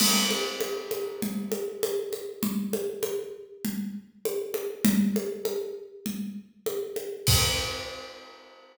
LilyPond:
\new DrumStaff \drummode { \time 4/4 \tempo 4 = 99 <cgl cymc>8 cgho8 cgho8 cgho8 cgl8 cgho8 cgho8 cgho8 | cgl8 cgho8 cgho4 cgl4 cgho8 cgho8 | cgl8 cgho8 cgho4 cgl4 cgho8 cgho8 | <cymc bd>4 r4 r4 r4 | }